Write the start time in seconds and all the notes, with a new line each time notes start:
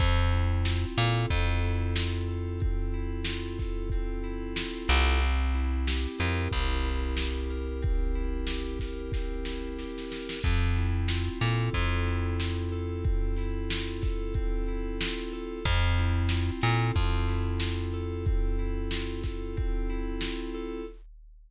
0.00 F2 C4, kick, crash
0.32 E4, closed hi-hat
0.65 F4, snare
0.98 A#2 A4, snare, closed hi-hat
1.30 F2 C4, kick, closed hi-hat
1.63 E4, closed hi-hat
1.96 F4, snare
2.28 A4, closed hi-hat
2.60 C4, kick, closed hi-hat
2.93 E4, closed hi-hat
3.24 F4, snare
3.59 A4, kick, snare, closed hi-hat
3.90 C4, kick, closed hi-hat
4.24 E4, closed hi-hat
4.56 F4, snare
4.88 C2 A4, snare
5.22 C4, closed hi-hat
5.54 E4, closed hi-hat
5.87 G4, snare
6.18 F2 A#4, snare, closed hi-hat
6.51 C2 C4, kick, closed hi-hat
6.84 E4, closed hi-hat
7.17 G4, snare
7.50 A#4, open hi-hat
7.82 C4, kick, closed hi-hat
8.14 E4, closed hi-hat
8.47 G4, snare
8.79 A#4, kick, snare, closed hi-hat
9.12 C4, kick, snare
9.45 E4, snare
9.78 G4, snare
9.98 snare
10.10 A#4, snare
10.29 snare
10.43 F2 C4, kick, crash
10.76 E4, closed hi-hat
11.08 F4, snare
11.41 A#2 A4, snare, closed hi-hat
11.74 F2 C4, kick, closed hi-hat
12.07 E4, closed hi-hat
12.40 F4, snare
12.71 A4, closed hi-hat
13.04 C4, kick, closed hi-hat
13.36 E4, snare, closed hi-hat
13.70 F4, snare
14.02 A4, kick, snare, closed hi-hat
14.34 C4, kick, closed hi-hat
14.66 E4, closed hi-hat
15.00 F4, snare
15.32 A4, closed hi-hat
15.65 F2 C4, kick, closed hi-hat
15.98 E4, closed hi-hat
16.29 F4, snare
16.61 A#2 A4, snare, closed hi-hat
16.95 F2 C4, kick, closed hi-hat
17.28 E4, snare, closed hi-hat
17.60 F4, snare
17.92 A4, closed hi-hat
18.26 C4, kick, closed hi-hat
18.58 E4, closed hi-hat
18.91 F4, snare
19.23 A4, kick, snare, closed hi-hat
19.57 C4, kick, closed hi-hat
19.89 E4, closed hi-hat
20.21 F4, snare
20.54 A4, closed hi-hat